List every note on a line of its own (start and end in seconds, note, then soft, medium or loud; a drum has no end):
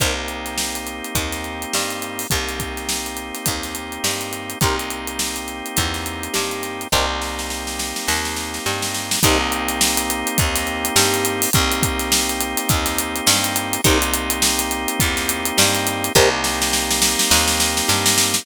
0.00 1.01 C2 medium
0.00 2.27 A#3 medium
0.00 2.27 C4 medium
0.00 0.14 D#4 medium
0.00 2.27 D#4 medium
0.00 2.27 G4 medium
0.00 0.14 G4 medium
0.00 0.14 A#4 medium
0.00 0.14 C5 loud
0.00 kick loud
0.00 closed hi-hat loud
0.28 closed hi-hat medium
0.46 snare soft
0.46 closed hi-hat medium
0.58 snare loud
0.75 closed hi-hat medium
0.87 closed hi-hat medium
1.04 closed hi-hat medium
1.15 1.66 D#2 medium
1.15 1.66 D#4 medium
1.15 kick medium
1.15 closed hi-hat loud
1.32 snare medium
1.32 closed hi-hat medium
1.44 closed hi-hat medium
1.62 closed hi-hat medium
1.73 2.25 G2 medium
1.73 2.24 G3 medium
1.73 snare loud
1.90 closed hi-hat medium
2.02 closed hi-hat medium
2.19 open hi-hat medium
2.30 3.32 C2 medium
2.30 4.59 A#3 medium
2.30 4.59 C4 medium
2.30 4.59 D#4 medium
2.30 4.59 G4 medium
2.30 kick loud
2.30 closed hi-hat loud
2.47 snare soft
2.47 closed hi-hat medium
2.59 kick medium
2.59 snare soft
2.59 closed hi-hat medium
2.77 snare soft
2.77 closed hi-hat medium
2.89 snare loud
3.06 closed hi-hat medium
3.17 closed hi-hat medium
3.35 snare soft
3.35 closed hi-hat medium
3.46 3.98 D#2 medium
3.46 3.96 D#4 medium
3.46 kick medium
3.46 closed hi-hat loud
3.63 snare medium
3.63 closed hi-hat medium
3.75 closed hi-hat medium
3.92 closed hi-hat medium
4.04 4.55 G2 medium
4.04 4.55 G3 medium
4.04 snare loud
4.21 closed hi-hat medium
4.33 closed hi-hat medium
4.50 closed hi-hat medium
4.61 5.62 C2 medium
4.61 6.88 A#3 medium
4.61 6.88 C4 medium
4.61 6.88 D#4 medium
4.61 4.76 D#4 medium
4.61 6.88 G4 medium
4.61 4.76 G4 medium
4.61 4.76 A#4 medium
4.61 4.76 C5 medium
4.61 kick loud
4.61 closed hi-hat loud
4.79 closed hi-hat medium
4.90 closed hi-hat medium
5.07 closed hi-hat medium
5.19 snare loud
5.36 closed hi-hat medium
5.48 closed hi-hat medium
5.66 closed hi-hat medium
5.76 6.28 E2 medium
5.76 6.27 D#4 medium
5.76 kick medium
5.76 closed hi-hat loud
5.94 snare medium
5.94 closed hi-hat medium
6.06 closed hi-hat medium
6.23 closed hi-hat medium
6.34 6.86 G2 medium
6.34 6.84 G3 medium
6.34 snare loud
6.51 closed hi-hat medium
6.63 snare soft
6.63 closed hi-hat medium
6.81 closed hi-hat medium
6.92 7.93 C2 medium
6.92 9.19 A#3 medium
6.92 9.19 C4 medium
6.92 7.06 D#4 medium
6.92 9.19 D#4 medium
6.92 7.06 G4 loud
6.92 9.19 G4 medium
6.92 7.06 A#4 loud
6.92 7.06 C5 medium
6.92 kick medium
7.22 snare medium
7.39 snare medium
7.50 snare medium
7.67 snare medium
7.79 snare loud
7.96 snare medium
8.07 8.59 D#2 medium
8.07 8.58 D#4 medium
8.07 snare loud
8.25 snare medium
8.36 snare medium
8.54 snare medium
8.66 9.17 G2 medium
8.66 9.16 G3 medium
8.66 snare medium
8.82 snare loud
8.94 snare medium
9.11 snare loud
9.23 10.24 C2 loud
9.23 11.50 A#3 loud
9.23 11.50 C4 loud
9.23 11.50 D#4 loud
9.23 9.38 D#4 loud
9.23 11.50 G4 loud
9.23 9.38 G4 loud
9.23 9.38 A#4 loud
9.23 9.38 C5 loud
9.23 kick loud
9.23 closed hi-hat loud
9.52 closed hi-hat medium
9.69 snare soft
9.69 closed hi-hat loud
9.81 snare loud
9.97 closed hi-hat loud
10.10 closed hi-hat loud
10.27 closed hi-hat loud
10.38 10.90 D#2 medium
10.38 10.89 D#4 medium
10.38 kick loud
10.38 closed hi-hat loud
10.56 snare medium
10.56 closed hi-hat loud
10.67 closed hi-hat medium
10.85 closed hi-hat loud
10.96 11.47 G2 medium
10.96 11.47 G3 medium
10.96 snare loud
11.14 closed hi-hat loud
11.25 closed hi-hat loud
11.42 open hi-hat loud
11.53 12.55 C2 loud
11.53 13.81 A#3 loud
11.53 13.81 C4 loud
11.53 13.81 D#4 loud
11.53 13.81 G4 loud
11.53 kick loud
11.53 closed hi-hat loud
11.71 snare soft
11.71 closed hi-hat loud
11.82 kick loud
11.82 snare soft
11.82 closed hi-hat loud
11.99 snare medium
11.99 closed hi-hat loud
12.12 snare loud
12.29 closed hi-hat medium
12.41 closed hi-hat loud
12.57 snare soft
12.57 closed hi-hat loud
12.69 13.21 D#2 medium
12.69 13.19 D#4 medium
12.69 kick loud
12.69 closed hi-hat loud
12.86 snare medium
12.86 closed hi-hat loud
12.98 closed hi-hat loud
13.16 closed hi-hat medium
13.26 13.78 G2 medium
13.26 13.77 G3 medium
13.26 snare loud
13.44 closed hi-hat loud
13.56 closed hi-hat loud
13.73 closed hi-hat loud
13.84 14.86 C2 medium
13.84 16.12 A#3 loud
13.84 16.12 C4 loud
13.84 13.98 D#4 loud
13.84 16.12 D#4 loud
13.84 13.98 G4 loud
13.84 16.12 G4 loud
13.84 13.98 A#4 loud
13.84 13.98 C5 loud
13.84 kick loud
13.84 closed hi-hat loud
14.02 closed hi-hat loud
14.14 closed hi-hat loud
14.30 closed hi-hat loud
14.42 snare loud
14.59 closed hi-hat loud
14.71 closed hi-hat loud
14.88 closed hi-hat loud
15.00 15.51 E2 medium
15.00 15.51 D#4 medium
15.00 kick loud
15.00 closed hi-hat loud
15.17 snare medium
15.17 closed hi-hat medium
15.29 closed hi-hat loud
15.45 closed hi-hat loud
15.57 16.09 G2 medium
15.57 16.08 G3 medium
15.57 snare loud
15.75 closed hi-hat medium
15.86 snare medium
15.86 closed hi-hat loud
16.04 closed hi-hat loud
16.15 17.16 C2 loud
16.15 18.43 A#3 loud
16.15 18.43 C4 loud
16.15 16.29 D#4 loud
16.15 18.43 D#4 loud
16.15 16.29 G4 loud
16.15 18.43 G4 loud
16.15 16.29 A#4 loud
16.15 16.29 C5 loud
16.15 kick loud
16.44 snare loud
16.62 snare loud
16.73 snare loud
16.91 snare loud
17.02 snare loud
17.19 snare loud
17.31 17.82 D#2 medium
17.31 17.81 D#4 medium
17.31 snare loud
17.48 snare loud
17.60 snare loud
17.77 snare loud
17.88 18.40 G2 medium
17.88 18.39 G3 medium
17.88 snare loud
18.06 snare loud
18.18 snare loud
18.34 snare loud